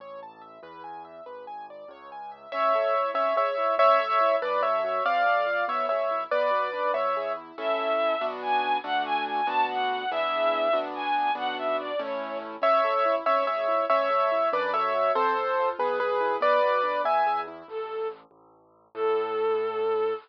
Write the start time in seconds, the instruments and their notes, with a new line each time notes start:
0.00 acoustic grand piano A1 C#5
0.23 acoustic grand piano A5
0.41 acoustic grand piano E5
0.63 acoustic grand piano E2 B4
0.84 acoustic grand piano G#5
1.05 acoustic grand piano E5
1.26 acoustic grand piano G#1 B4
1.47 acoustic grand piano G#5
1.70 acoustic grand piano D5
1.88 acoustic grand piano C#2 C#5
2.12 acoustic grand piano G#5
2.32 acoustic grand piano E5
2.52 acoustic grand piano A1 C#4 C#5 E5
2.75 acoustic grand piano A4
2.95 acoustic grand piano E4
3.14 acoustic grand piano G#1 C#4 C#5 E5
3.36 acoustic grand piano G#4 C#5 E5
3.57 acoustic grand piano E4
3.78 acoustic grand piano A1 C#4 C#5 E5
3.99 acoustic grand piano A4
4.21 acoustic grand piano E4
4.42 acoustic grand piano F#2 D4 B4 D5
4.63 acoustic grand piano A4 C#5 E5
4.84 acoustic grand piano F#4
5.05 acoustic grand piano F2 C4 D5 F5
5.26 acoustic grand piano A4
5.46 acoustic grand piano F4
5.68 acoustic grand piano B1 B3 C#5 E5
5.89 acoustic grand piano G#4 C#5 E5
6.11 acoustic grand piano E4
6.31 acoustic grand piano B1 B3 B4 D5
6.51 acoustic grand piano F#4
6.73 acoustic grand piano D4
6.93 acoustic grand piano E2 B3 C#5 E5
7.17 acoustic grand piano G#4
7.37 acoustic grand piano E4
7.58 acoustic grand piano A1 C#4 E4 A4, violin E5
8.21 acoustic grand piano B1 B3 D4 F#4
8.42 violin G#5
8.84 acoustic grand piano D2 A3 D4 F#4, violin F#5
9.05 violin G#5
9.26 violin G#5
9.47 acoustic grand piano D2 B3 D4 F#4, violin A5
9.69 violin F#5
10.11 acoustic grand piano E2 B3 D4 E4 G#4, violin E5
10.73 acoustic grand piano D2 B3 D4 F#4
10.95 violin G#5
11.35 acoustic grand piano B1 B3 D4 F#4, violin F#5
11.58 violin E5
11.79 violin D5
11.99 acoustic grand piano A1 A3 C#4 E4, violin C#5
12.62 acoustic grand piano A1 C#4 C#5 E5
12.84 acoustic grand piano A4
13.05 acoustic grand piano E4
13.26 acoustic grand piano G#1 C#4 C#5 E5
13.47 acoustic grand piano G#4 C#5 E5
13.68 acoustic grand piano E4
13.90 acoustic grand piano A1 C#4 C#5 E5
14.10 acoustic grand piano A4
14.32 acoustic grand piano E4
14.53 acoustic grand piano F#2 D4 B4 D5
14.73 acoustic grand piano A4 C#5 E5
14.95 acoustic grand piano F#4
15.15 acoustic grand piano F2 C4 A4 C5
15.37 acoustic grand piano A4
15.59 acoustic grand piano F4
15.79 acoustic grand piano B1 B3 G#4 B4
16.00 acoustic grand piano G#4 B4
16.21 acoustic grand piano E4
16.41 acoustic grand piano B1 B3 B4 D5
16.63 acoustic grand piano F#4
16.83 acoustic grand piano D4
17.04 acoustic grand piano E2 B3 E5 G#5
17.27 acoustic grand piano G#4
17.48 acoustic grand piano E4
17.68 acoustic grand piano A1, violin A4
18.31 acoustic grand piano A1
18.95 acoustic grand piano A2, violin A4